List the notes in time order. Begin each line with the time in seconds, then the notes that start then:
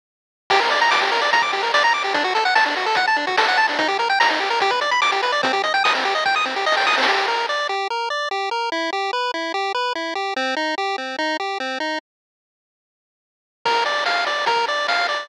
0.50 G4, kick, crash
0.60 A#4, closed hi-hat
0.70 D5, closed hi-hat
0.81 A#5, closed hi-hat
0.91 D6, snare
1.01 G4, closed hi-hat
1.12 A#4, closed hi-hat
1.21 D5, closed hi-hat
1.33 A#5, kick, closed hi-hat
1.42 D6, kick, closed hi-hat
1.52 G4, closed hi-hat
1.63 A#4, closed hi-hat
1.74 D5, snare
1.83 A#5, closed hi-hat
1.93 D6, closed hi-hat
2.03 G4, closed hi-hat
2.14 D4, kick, closed hi-hat
2.24 F#4, closed hi-hat
2.35 A4, closed hi-hat
2.45 F#5, closed hi-hat
2.55 A5, snare
2.65 D4, closed hi-hat
2.76 F#4, closed hi-hat
2.86 A4, closed hi-hat
2.95 F#5, kick, closed hi-hat
3.07 A5, closed hi-hat
3.16 D4, closed hi-hat
3.27 F#4, kick, closed hi-hat
3.37 A4, snare
3.48 F#5, closed hi-hat
3.57 A5, closed hi-hat
3.68 D4, open hi-hat
3.79 D#4, kick, closed hi-hat
3.88 G4, closed hi-hat
3.99 A#4, closed hi-hat
4.09 G5, closed hi-hat
4.20 A#5, snare
4.29 D#4, closed hi-hat
4.40 G4, closed hi-hat
4.50 A#4, closed hi-hat
4.60 G4, kick, closed hi-hat
4.70 B4, kick, closed hi-hat
4.81 D5, closed hi-hat
4.91 B5, closed hi-hat
5.02 D6, snare
5.12 G4, closed hi-hat
5.23 B4, closed hi-hat
5.32 D5, closed hi-hat
5.43 C4, kick, closed hi-hat
5.53 G4, closed hi-hat
5.64 D#5, closed hi-hat
5.74 G5, closed hi-hat
5.84 D#6, snare
5.95 C4, closed hi-hat
6.04 G4, closed hi-hat
6.15 D#5, closed hi-hat
6.25 G5, kick, snare
6.35 D#6, snare
6.45 C4, snare
6.55 G4, snare
6.66 D#5, snare
6.72 snare
6.77 G5, snare
6.81 snare
6.87 D#6, snare
6.92 snare
6.98 C4, snare
7.03 snare
7.07 G4
7.28 A#4
7.49 D5
7.69 G4
7.90 A#4
8.10 D5
8.31 G4
8.51 A#4
8.72 E4
8.93 G4
9.13 B4
9.34 E4
9.54 G4
9.74 B4
9.95 E4
10.15 G4
10.36 C4
10.56 D#4
10.78 G4
10.98 C4
11.18 D#4
11.40 G4
11.60 C4
11.80 D#4
13.65 A#4, kick, crash
13.86 D5, closed hi-hat
14.06 F5, snare
14.27 D5, closed hi-hat
14.46 A#4, kick, closed hi-hat
14.56 kick
14.68 D5, closed hi-hat
14.88 F5, snare
15.08 D5, closed hi-hat